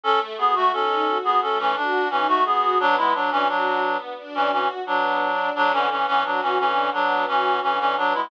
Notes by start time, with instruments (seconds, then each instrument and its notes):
0.03 string ensemble 1 A3, clarinet C#4 A4
0.38 clarinet B3 G#4, string ensemble 1 F#4
0.55 clarinet A3 F#4
0.72 clarinet C#4 A4, string ensemble 1 D#4
1.07 string ensemble 1 F#4
1.24 clarinet B3 G#4
1.42 string ensemble 1 A3, clarinet C#4 A4
1.59 clarinet E3 C#4
1.76 clarinet D4, string ensemble 1 F#4
2.10 clarinet E3 C#4, string ensemble 1 D#4
2.28 clarinet A3 F#4
2.45 clarinet B3 G#4, string ensemble 1 F#4
2.78 clarinet F#3 D4, string ensemble 1 B3
2.97 clarinet G#3 E4
3.14 clarinet F#3 D4, string ensemble 1 D4
3.31 clarinet E3 C#4
3.48 clarinet F#3 D4, string ensemble 1 F#4
3.82 string ensemble 1 B3
4.18 string ensemble 1 D4
4.35 clarinet E3 C#4
4.51 clarinet E3 C#4, string ensemble 1 F#4
4.86 clarinet F#3 D4, string ensemble 1 B3
5.21 string ensemble 1 D4
5.55 string ensemble 1 D3, clarinet F#3 D4
5.73 clarinet E3 C#4
5.90 clarinet E3 C#4, string ensemble 1 B3
6.07 clarinet E3 C#4
6.24 clarinet F#3 D4, string ensemble 1 F#4
6.42 clarinet E3 C#4
6.59 string ensemble 1 D3, clarinet E3 C#4
6.93 clarinet F#3 D4, string ensemble 1 B3
7.27 clarinet E3 C#4, string ensemble 1 F#4
7.62 string ensemble 1 D3, clarinet E3 C#4
7.79 clarinet E3 C#4
7.97 clarinet F#3 D4, string ensemble 1 B3
8.14 clarinet G#3 E4